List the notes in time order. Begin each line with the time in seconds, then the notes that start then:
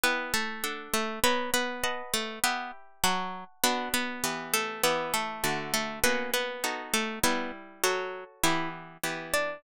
0.04 B3 E4 B4 G5
0.34 A3 A4
0.64 D4 A4 F#5
0.94 A3 A4
1.24 B3 A#4 B4 C#5 F#5
1.54 B3 B4
1.84 B4 D#5 F#5 A5
2.14 A3 A4
2.44 B3 G4 B4 E5 B5
3.04 F#3 F#4 F#5 A5 C#6
3.64 B3 D4 F#4 B4
3.94 B3 B4
4.24 E3 B3 G4
4.54 A3 A4
4.83 E3 B3 G4 B4
5.14 A3 A4
5.44 D3 A3 F#4
5.74 A3 A4
6.04 A#3 B3 C#4 F#4 B4
6.34 B3 B4
6.64 B3 D#4 F#4 A4
6.94 A3 A4
7.23 G3 B3 E4 B4
7.84 F#3 F#4 A4 C#5
8.44 E3 B3 E4 G4 E5
9.04 E3 B3 G4
9.34 D4 D5